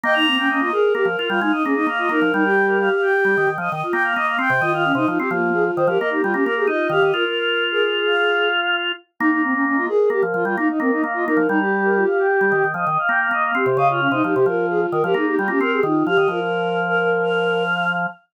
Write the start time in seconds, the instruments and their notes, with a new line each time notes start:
0.04 drawbar organ A#3, flute D#5, choir aahs G5
0.14 flute D#4, choir aahs A#5
0.27 flute C4
0.38 flute C#4, choir aahs G5
0.49 flute C#4, choir aahs D#5
0.60 flute F4, choir aahs D#5
0.72 flute G#4, choir aahs A#4
0.95 drawbar organ A#3, flute G4
1.05 drawbar organ F3
1.18 flute F4, drawbar organ F4
1.29 drawbar organ G3, flute F4, choir aahs F5
1.41 drawbar organ G#3, flute D#4, choir aahs F5
1.52 flute D#4, choir aahs D#5
1.63 drawbar organ A#3, flute C#4, choir aahs G#4
1.75 flute D#4, choir aahs D#5
1.87 drawbar organ A#3, choir aahs F5
1.98 flute F4, choir aahs D#5
2.09 drawbar organ A#3, flute D#4, choir aahs A#4
2.22 drawbar organ F3
2.33 drawbar organ G3, flute D#4, choir aahs A#4
2.44 flute G4, choir aahs G5
2.67 choir aahs A#4
2.79 choir aahs F5
2.91 choir aahs F5
3.01 choir aahs G5
3.25 drawbar organ G3
3.37 drawbar organ D#3
3.47 drawbar organ D#3
3.58 drawbar organ F3, choir aahs D#5
3.70 drawbar organ D#3, choir aahs D#5
3.83 choir aahs F4
3.92 drawbar organ A#3, choir aahs G5
4.04 choir aahs F5
4.15 drawbar organ A#3, choir aahs D#5
4.26 choir aahs F5
4.39 drawbar organ C4, choir aahs G5
4.50 drawbar organ C3
4.60 drawbar organ D#3, flute F4, choir aahs D#5
4.73 flute F4, choir aahs F5
4.85 flute C#4
4.95 drawbar organ C3, flute D#4, choir aahs D#5
5.07 drawbar organ F3, flute D#4, choir aahs F4
5.18 drawbar organ C4, choir aahs G4, flute G4
5.30 drawbar organ F3, flute A#3, choir aahs F4
5.54 flute G#4
5.76 drawbar organ D#3, flute C5
5.87 drawbar organ F3, flute G4, choir aahs A#4
5.98 drawbar organ A#3, choir aahs A#4, flute D#5
6.10 flute D#4, choir aahs G4
6.22 drawbar organ G3, choir aahs F4, flute F4
6.33 drawbar organ A#3, flute C#4, choir aahs G4
6.43 drawbar organ A#3, choir aahs A#4
6.56 choir aahs G4, flute G#4
6.67 drawbar organ D#4, choir aahs F4, flute D#5
6.90 drawbar organ D#3, flute G4, choir aahs F5
7.02 drawbar organ D#3, choir aahs D#5
7.13 drawbar organ F4, flute F4, choir aahs A#4
7.24 choir aahs A#4
7.71 flute G#4, choir aahs A#4
7.83 choir aahs G#4
8.06 choir aahs F5
9.19 drawbar organ A#3, flute D#4, choir aahs G5
9.31 flute D#4, choir aahs A#5
9.43 flute C4
9.53 flute C#4, choir aahs G5
9.66 flute C#4, choir aahs D#5
9.77 flute F4, choir aahs D#5
9.88 flute G#4, choir aahs A#4
10.10 drawbar organ A#3, flute G4
10.23 drawbar organ F3
10.34 drawbar organ F3, flute F4
10.45 drawbar organ G3, flute F4, choir aahs F5
10.57 drawbar organ A#3, flute D#4, choir aahs F5
10.69 flute D#4, choir aahs D#5
10.80 drawbar organ A#3, flute C4, choir aahs A#4
10.92 flute D#4, choir aahs D#5
11.02 drawbar organ A#3, choir aahs F5
11.14 flute F4, choir aahs D#5
11.26 drawbar organ A#3, flute D#4, choir aahs A#4
11.37 drawbar organ F3
11.49 drawbar organ G3, flute D#4, choir aahs A#5
11.60 flute G4, choir aahs G4
11.84 choir aahs A#4
11.96 choir aahs F4
12.06 choir aahs F5
12.19 choir aahs G5
12.41 drawbar organ G3
12.52 drawbar organ D#3
12.64 drawbar organ D#3
12.74 drawbar organ F3, choir aahs D#5
12.87 drawbar organ D#3, choir aahs D#5
12.99 choir aahs F5
13.08 drawbar organ A#3, choir aahs G5
13.20 choir aahs F5
13.31 drawbar organ A#3, choir aahs D#5
13.44 choir aahs F5
13.55 drawbar organ C4, choir aahs G4
13.66 drawbar organ C3
13.77 drawbar organ C#3, choir aahs D#5, flute F5
13.90 flute F4, choir aahs F5
14.00 flute C#4
14.11 drawbar organ C3, flute D#4, choir aahs D#5
14.24 drawbar organ F3, flute D#4, choir aahs G4
14.34 drawbar organ C3, choir aahs G4, flute G4
14.46 drawbar organ F3, choir aahs F4, flute A#4
14.70 flute G#4
14.92 drawbar organ D#3, flute A#4
15.04 drawbar organ F3, flute G4, choir aahs A#4
15.14 drawbar organ A#3, flute D#4, choir aahs G#4
15.26 flute D#4, choir aahs G4
15.37 drawbar organ G3, choir aahs F4, flute F4
15.48 drawbar organ A#3, flute C#4, choir aahs G4
15.60 drawbar organ C4, choir aahs A#4
15.72 choir aahs G4, flute G#4
15.83 drawbar organ D#3, flute D#4, choir aahs F4
16.06 drawbar organ F3, flute G4, choir aahs F5
16.17 drawbar organ D#3, choir aahs D#5
16.28 drawbar organ F3, flute F4, choir aahs A#4
16.41 choir aahs A#4
16.87 flute A#4, choir aahs A#4
16.99 choir aahs A#4
17.22 choir aahs F5